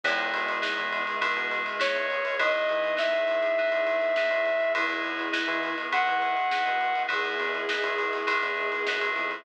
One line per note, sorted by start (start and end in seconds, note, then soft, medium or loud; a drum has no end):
0.04 0.31 E2 loud
0.04 1.94 G#3 medium
0.04 2.36 B3 medium
0.04 0.57 B3 medium
0.04 2.36 D#4 medium
0.04 0.57 D#4 medium
0.04 2.36 E4 medium
0.04 0.57 E4 loud
0.04 2.36 G#4 medium
0.04 0.57 G#4 medium
0.04 kick medium
0.04 crash medium
0.19 ride medium
0.33 0.60 B2 medium
0.33 ride medium
0.48 ride medium
0.62 1.15 B3 medium
0.62 1.15 D#4 medium
0.62 1.15 E4 medium
0.62 1.15 G#4 medium
0.62 snare medium
0.78 1.04 E2 medium
0.78 kick medium
0.78 ride medium
0.93 ride medium
1.07 ride medium
1.21 1.74 B3 medium
1.21 1.74 D#4 medium
1.21 1.74 E4 medium
1.21 1.74 G#4 medium
1.21 kick medium
1.21 ride medium
1.37 1.63 B2 medium
1.37 ride medium
1.51 snare soft
1.51 ride medium
1.66 ride medium
1.79 2.32 B3 medium
1.79 2.32 D#4 medium
1.79 2.32 E4 medium
1.79 2.32 G#4 medium
1.79 2.36 C#5 medium
1.79 snare loud
1.95 2.22 E2 medium
1.95 ride medium
2.10 ride medium
2.25 ride medium
2.39 2.66 E2 medium
2.39 2.92 B3 loud
2.39 4.73 B3 medium
2.39 2.92 D#4 medium
2.39 4.32 D#4 medium
2.39 4.73 D#4 medium
2.39 2.92 E4 loud
2.39 4.73 E4 medium
2.39 2.92 G#4 loud
2.39 4.73 G#4 medium
2.39 2.95 D#5 soft
2.39 kick medium
2.39 ride medium
2.54 ride medium
2.69 2.97 E3 medium
2.69 ride medium
2.84 ride medium
2.96 3.49 B3 medium
2.96 3.49 D#4 medium
2.96 3.49 E4 medium
2.96 3.49 G#4 medium
2.96 4.72 E5 medium
2.96 snare medium
3.13 3.41 E2 medium
3.13 kick medium
3.13 ride medium
3.28 snare soft
3.28 ride medium
3.43 ride medium
3.57 4.11 B3 medium
3.57 4.11 D#4 medium
3.57 4.11 E4 medium
3.57 4.11 G#4 medium
3.57 kick medium
3.57 ride soft
3.72 4.00 E2 medium
3.72 ride medium
3.87 ride medium
4.01 ride medium
4.16 4.70 B3 medium
4.16 4.70 D#4 medium
4.16 4.70 E4 medium
4.16 4.70 G#4 medium
4.16 snare medium
4.31 4.58 E2 medium
4.31 ride medium
4.46 ride medium
4.60 ride medium
4.75 5.03 E2 medium
4.75 7.08 B3 medium
4.75 5.28 B3 medium
4.75 7.08 D#4 medium
4.75 5.28 D#4 loud
4.75 5.75 E4 medium
4.75 7.08 E4 medium
4.75 5.28 E4 loud
4.75 7.08 G#4 medium
4.75 5.28 G#4 loud
4.75 kick medium
4.75 ride loud
4.90 snare soft
4.90 ride medium
5.04 5.30 E2 medium
5.04 ride medium
5.19 ride medium
5.33 5.86 B3 medium
5.33 5.86 D#4 medium
5.33 5.86 E4 medium
5.33 5.86 G#4 medium
5.33 snare medium
5.48 5.74 E3 medium
5.48 kick medium
5.48 ride medium
5.63 ride medium
5.78 ride medium
5.92 6.45 B3 medium
5.92 6.45 D#4 medium
5.92 6.45 E4 medium
5.92 6.45 G#4 medium
5.92 7.03 F#5 soft
5.92 kick medium
5.92 ride medium
6.07 6.35 E3 medium
6.07 ride medium
6.22 ride medium
6.37 ride medium
6.51 7.05 B3 medium
6.51 7.05 D#4 medium
6.51 7.05 E4 medium
6.51 7.05 G#4 medium
6.51 snare medium
6.66 6.93 B2 medium
6.66 ride medium
6.81 ride medium
6.95 ride medium
7.08 7.37 E2 medium
7.08 7.61 B3 loud
7.08 9.43 B3 loud
7.08 7.61 D#4 medium
7.08 9.43 D#4 medium
7.08 7.61 E4 medium
7.08 9.43 E4 loud
7.08 7.61 G#4 loud
7.08 9.43 G#4 loud
7.08 9.11 G#4 medium
7.08 kick medium
7.08 ride medium
7.25 ride medium
7.40 7.66 E2 medium
7.40 ride medium
7.54 ride medium
7.69 8.23 B3 medium
7.69 8.23 D#4 medium
7.69 8.23 E4 medium
7.69 8.23 G#4 medium
7.69 snare medium
7.83 8.10 E2 medium
7.83 kick medium
7.83 ride medium
7.98 ride medium
8.13 ride medium
8.27 8.80 B3 medium
8.27 8.80 D#4 medium
8.27 8.80 E4 medium
8.27 8.80 G#4 medium
8.27 kick medium
8.27 ride medium
8.43 8.69 E2 medium
8.43 snare soft
8.43 ride medium
8.57 ride medium
8.72 ride medium
8.87 9.13 F#2 medium
8.87 9.41 B3 medium
8.87 9.41 D#4 medium
8.87 9.41 E4 medium
8.87 9.41 G#4 medium
8.87 snare medium
9.01 ride medium
9.16 9.43 F2 medium
9.16 ride medium
9.31 ride medium